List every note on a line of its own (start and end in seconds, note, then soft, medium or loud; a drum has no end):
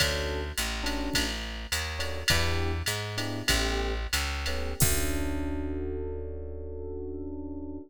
0.00 0.52 D2 loud
0.00 0.40 C#4 loud
0.00 0.40 D4 loud
0.00 0.40 F#4 loud
0.00 0.40 A4 loud
0.00 kick medium
0.00 ride loud
0.58 1.10 A1 loud
0.58 hi-hat pedal medium
0.58 ride medium
0.83 1.23 C#4 medium
0.83 1.23 D4 medium
0.83 1.23 F#4 medium
0.83 1.23 A4 medium
0.83 ride medium
1.13 1.67 A1 loud
1.13 kick medium
1.13 ride loud
1.72 2.24 D#2 medium
1.72 hi-hat pedal medium
1.72 ride medium
1.99 2.19 C#4 medium
1.99 2.19 D4 medium
1.99 2.19 F#4 loud
1.99 2.19 A4 medium
1.99 ride medium
2.28 2.82 E2 loud
2.28 2.71 B3 loud
2.28 2.71 D4 loud
2.28 2.71 E4 loud
2.28 2.71 G4 loud
2.28 kick medium
2.28 ride loud
2.86 3.43 G#2 loud
2.86 hi-hat pedal medium
2.86 ride medium
3.17 3.39 B3 medium
3.17 3.39 D4 medium
3.17 3.39 E4 medium
3.17 3.39 G4 loud
3.17 ride medium
3.48 4.07 A1 loud
3.48 3.92 A3 loud
3.48 3.92 B3 loud
3.48 3.92 C#4 loud
3.48 3.92 G4 loud
3.48 kick medium
3.48 ride loud
4.13 4.74 C#2 loud
4.13 hi-hat pedal medium
4.13 ride medium
4.46 4.71 A3 medium
4.46 4.71 B3 medium
4.46 4.71 C#4 medium
4.46 4.71 G4 medium
4.46 ride medium
4.80 7.79 D2 loud
4.80 7.78 C#4 medium
4.80 7.78 D4 loud
4.80 7.78 F#4 medium
4.80 7.78 A4 loud
4.80 kick loud
4.80 crash loud